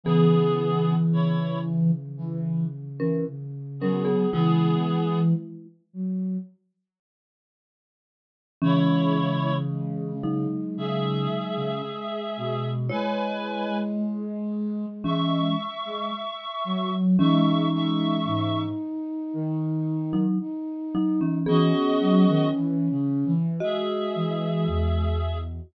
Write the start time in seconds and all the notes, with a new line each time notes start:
0.03 C#3 E3 B3 G#4
1.10 C#3 E4 C#5
2.17 E3
2.99 E3 C#4 A#4
3.27 C#3
3.79 F#3 B3 C#4 G#4 A#4
4.05 B3 G#4
4.31 C#3 E3 G#3 B3 E4 G#4
4.87 E3
5.93 F#3
8.61 C#3 E3 G#3 C#4 E4 C#5
9.68 G#3
10.23 F#3 D#4
10.76 C#3 G#4 E5
11.56 C#3
11.84 G#3
12.36 B2
12.89 G#3 E4 B4 C#5 G#5
13.98 G#3
15.04 E3 G#3 C#4 E5 C#6
15.85 G#3
16.64 F#3
17.18 E3 G#3 C#4 D#4 E5 C#6
17.72 G#3 E5 C#6
18.25 G#2 D#4
19.33 D#3
20.13 F#3 D#4
20.40 D#4
20.95 F#3 D#4
21.21 E3 C#4
21.46 E3 B3 C#4 F#4 G#4 D#5
22.00 F#3
22.28 D#3
22.54 E3
22.90 C#3
23.25 E3
23.60 G#3 F#4 G#4 D#5 E5
24.15 E3
24.67 E2